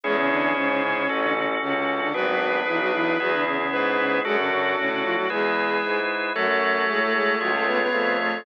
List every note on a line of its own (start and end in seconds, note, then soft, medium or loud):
0.03 0.51 E2 loud
0.03 0.16 G#3 medium
0.03 1.31 C#4 medium
0.03 1.07 C#4 medium
0.03 1.07 E4 medium
0.03 0.16 G#4 medium
0.03 1.07 G#4 medium
0.17 0.29 C#3 medium
0.17 0.29 C#4 medium
0.30 0.55 D3 medium
0.30 0.55 D4 medium
0.55 1.03 G#2 medium
0.55 0.69 C#3 medium
0.55 0.69 C#4 medium
0.69 0.82 C#3 medium
0.69 0.82 C#4 medium
0.83 0.95 C#3 medium
0.83 0.95 C#4 medium
0.96 1.08 C#3 medium
0.96 1.08 C#4 medium
1.08 1.56 A1 medium
1.08 2.12 C#4 medium
1.08 2.12 F#4 medium
1.08 2.12 A4 medium
1.22 1.34 D3 medium
1.22 1.34 D4 medium
1.35 1.47 C#3 medium
1.35 1.47 C#4 medium
1.61 2.08 C#2 medium
1.61 1.74 C#3 medium
1.61 1.74 C#4 medium
1.75 2.01 C#3 medium
1.75 2.01 C#4 medium
2.01 2.13 D3 medium
2.01 2.13 D4 medium
2.14 2.62 G#1 medium
2.14 2.26 F#3 medium
2.14 3.17 B3 medium
2.14 3.17 D4 medium
2.14 2.26 F#4 medium
2.14 3.17 G#4 medium
2.14 3.41 B4 medium
2.27 2.59 F#3 medium
2.27 2.59 F#4 medium
2.67 3.14 B1 medium
2.67 2.79 E3 medium
2.67 2.79 E4 medium
2.80 2.92 F#3 medium
2.80 2.92 F#4 medium
2.93 3.18 E3 medium
2.93 3.18 E4 medium
3.19 3.67 E2 loud
3.19 3.32 F#3 medium
3.19 4.23 B3 medium
3.19 4.23 E4 medium
3.19 3.32 F#4 medium
3.19 4.23 G#4 medium
3.32 3.45 D3 medium
3.32 3.45 D4 medium
3.46 3.58 C#3 medium
3.46 3.58 C#4 medium
3.59 3.97 C#3 medium
3.59 3.97 C#4 medium
3.71 4.19 G#2 medium
3.71 4.18 B4 medium
3.98 4.20 C#3 medium
3.98 4.20 C#4 medium
4.24 4.72 F#2 medium
4.24 4.37 G#3 medium
4.24 5.28 D4 medium
4.24 5.28 F#4 medium
4.24 5.10 F#4 medium
4.24 4.37 G#4 medium
4.24 5.28 A4 medium
4.38 4.50 C#3 medium
4.38 4.50 C#4 medium
4.51 4.76 C#3 medium
4.51 4.76 C#4 medium
4.77 5.25 A2 medium
4.77 4.90 C#3 medium
4.77 4.90 C#4 medium
4.90 5.03 C#3 medium
4.90 5.03 C#4 medium
5.04 5.16 F3 medium
5.04 5.16 F4 medium
5.17 5.29 F#3 medium
5.17 5.29 F#4 medium
5.29 5.77 E2 loud
5.29 6.00 G#3 medium
5.29 6.33 E4 medium
5.29 6.33 G#4 medium
5.29 6.00 G#4 medium
5.29 6.33 B4 medium
5.82 6.30 G#2 medium
6.35 6.82 F#2 medium
6.35 6.48 F#3 medium
6.35 7.80 A3 medium
6.35 6.48 F#4 medium
6.35 7.39 F#4 medium
6.35 7.39 A4 medium
6.35 7.39 C#5 medium
6.48 6.85 F#3 medium
6.48 6.85 F#4 medium
6.88 7.36 A2 medium
6.88 7.00 G#3 medium
6.88 7.00 G#4 medium
7.01 7.13 A3 medium
7.01 7.13 A4 medium
7.14 7.36 G#3 medium
7.14 7.36 G#4 medium
7.40 7.88 C#2 medium
7.40 7.53 F#3 medium
7.40 8.44 F4 medium
7.40 7.53 F#4 medium
7.40 8.44 G#4 medium
7.40 8.44 C#5 medium
7.54 7.66 A3 medium
7.54 7.66 A4 medium
7.67 7.79 B3 medium
7.67 7.79 B4 medium
7.80 8.17 B3 medium
7.80 8.17 B4 medium
7.92 8.40 F2 medium
7.92 8.36 A3 medium
8.19 8.44 A3 medium
8.19 8.44 A4 medium